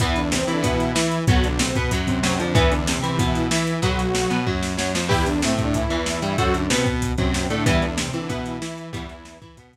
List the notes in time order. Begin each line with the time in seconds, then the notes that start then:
0.00 E2 E3 B3 E4, kick, closed hi-hat
0.16 D3 D4, closed hi-hat
0.32 C3 C4, snare
0.42 C3 C4
0.47 E3 E4, closed hi-hat
0.53 D3 D4
0.63 B2 E3 B3 E4, kick, closed hi-hat
0.80 closed hi-hat
0.95 E3 E4, snare
1.12 closed hi-hat
1.27 B1 F#3 B3 F#4, kick, closed hi-hat
1.44 D3 D4, closed hi-hat
1.59 C3 C4, snare
1.75 B2 B3, kick, closed hi-hat
1.91 F#2 F#3, kick, closed hi-hat
2.07 C3 C4, kick, closed hi-hat
2.23 F#2 F#3, snare
2.39 F2 D3 F3 D4, closed hi-hat
2.55 E2 E3 B3 E4, kick, closed hi-hat
2.71 D3 D4, closed hi-hat
2.87 C3 C4, snare
2.98 C3 C4
3.02 E3 E4, closed hi-hat
3.09 C3 C4
3.19 B2 E3 B3 E4, kick, closed hi-hat
3.35 closed hi-hat
3.51 E3 E4, snare
3.67 closed hi-hat
3.82 B1 F#3 B3 F#4, kick, closed hi-hat
3.99 closed hi-hat
4.15 snare
4.30 B2 B3, closed hi-hat
4.46 F#2 F#3, kick
4.63 snare
4.77 F#2 F#3, snare
4.94 F2 F3, snare
5.09 E2 E3 E4 G4 B4, kick, crash
5.26 D3 D4, closed hi-hat
5.42 A2 C3 A3 C4, snare
5.53 C3 C4
5.58 kick, closed hi-hat
5.64 D3 D4
5.74 E3 E4, kick, closed hi-hat
5.90 E2 E3, closed hi-hat
6.06 snare
6.22 G2 G3, closed hi-hat
6.38 F#2 F#3 F#4 A4 C5, kick, closed hi-hat
6.54 D3 D4, closed hi-hat
6.70 B2 C3 B3 C4, snare
6.86 kick, closed hi-hat
7.02 kick, closed hi-hat
7.18 F#2 C3 F#3 C4, kick, closed hi-hat
7.34 snare
7.50 A2 D3 A3 D4, closed hi-hat
7.66 E2 E3 G3 B3 E4, kick, closed hi-hat
7.82 D3 D4, closed hi-hat
7.98 C3 C4, snare
8.09 C3 C4
8.13 E3 E4, closed hi-hat
8.19 D3 D4
8.29 B2 E3 B3 E4, kick, closed hi-hat
8.46 closed hi-hat
8.62 E3 E4, snare
8.78 closed hi-hat
8.93 E2 E3 G3 B3 E4, kick, closed hi-hat
9.09 closed hi-hat
9.25 snare
9.41 E3 E4, kick, closed hi-hat
9.57 B2 B3, kick, closed hi-hat
9.73 kick, closed hi-hat